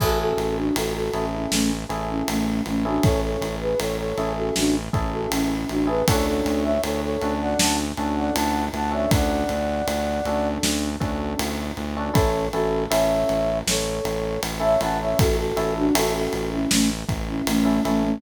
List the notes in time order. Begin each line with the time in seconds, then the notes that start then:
0.00 A1 C#4 E4 F#4 G#4 A4, kick, crash
0.20 F#4 A4
0.38 A1, ride
0.57 D4 F#4
0.76 A1 F#4 A4, ride
0.95 F#4 A4
1.13 A1 C#4 E4 G#4 A4, ride
1.33 C#4 E4
1.52 A1 A3 C#4, snare
1.89 A1 C#4 E4 G#4 A4, ride
2.09 C#4 E4
2.28 A1 A3 C#4, ride
2.66 A1 A3 C#4, ride
2.85 C#4 D4 E4 F#4 G#4 A4
3.03 A1 A4 C#5, kick, ride
3.23 A4 C#5
3.41 A1, ride
3.61 G#4 B4
3.79 A1 A4 C#5, ride
3.98 A4 C#5
4.18 A1 C#4 E4 G#4 A4, ride
4.36 F#4 A4
4.56 A1 D4 F#4, snare
4.93 A1 C#4 E4 G#4 A4, kick, ride
5.12 F#4 A4
5.31 A1 C#4 E4, ride
5.69 A1 D4 F#4, ride
5.87 C#4 E4 G#4 A4 B4
6.08 D2 C#4 D4 F#4 A4 C#5, kick, ride
6.27 A4 C#5
6.45 D2, ride
6.64 C#5 E5
6.83 D2 A4 C#5, ride
7.03 A4 C#5
7.22 D2 C#4 D4 F#4 A4, ride
7.41 D5 F#5
7.59 D2 F#5 A5, snare
7.97 D2 C#4 D4 F#4 A4, ride
8.16 D5 F#5
8.34 D2 F#5 A5, ride
8.73 D2 F#5 A5, ride
8.91 C#4 D4 F#4 A4 C#5 E5
9.11 D2 D5 F#5, kick, ride
9.49 D2, ride
9.87 D2, ride
10.25 D2 C#4 D4 F#4 A4, ride
10.63 D2, snare
11.00 D2 C#4 D4 F#4 A4, kick, ride
11.39 D2, ride
11.77 D2, ride
11.97 C#4 D4 F#4 A4
12.14 A1 C#4 E4 A4 C#5, kick, ride
12.53 A1 C#4 E4 F#4 A4, ride
12.90 A1 C#4 E4 A4 C#5 E5, ride
13.29 A1, ride
13.67 A1 A4 C#5, snare
14.05 A1, ride
14.43 A1, ride
14.60 C#4 E4 A4 C#5 E5
14.80 A1 C#4 E4 A4 F#5 A5, ride
15.01 C#5 E5
15.19 A1 F#4 A4, kick, ride
15.38 F#4 A4
15.56 A1 C#4 E4 A4, ride
15.76 D4 F#4
15.95 A1 C#4 E4 F#4 A4, ride
16.15 F#4 A4
16.33 A1, ride
16.52 C#4 E4
16.71 A1 A3 C#4, snare
17.09 A1, kick, ride
17.28 C#4 E4
17.47 A1 A3 C#4, ride
17.65 C#4 E4 A4
17.85 A1 A3 C#4 E4 A4, ride
18.04 A3 C#4